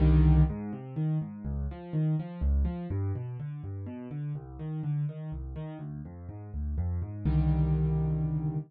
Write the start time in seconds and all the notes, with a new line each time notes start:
0.00 C2 D3 D#3 G3
0.50 G#2
0.73 C3
0.96 D#3
1.21 G#2
1.45 C#2
1.71 F3
1.93 D#3
2.19 F3
2.41 C#2
2.65 F3
2.90 G2
3.15 B2
3.40 D3
3.64 G2
3.86 B2
4.11 D3
4.35 C2
4.59 D#3
4.83 D3
5.09 D#3
5.32 C2
5.56 D#3
5.79 D2
6.05 F2
6.29 G#2
6.54 D2
6.78 F2
7.02 G#2
7.25 C2 D3 D#3 G3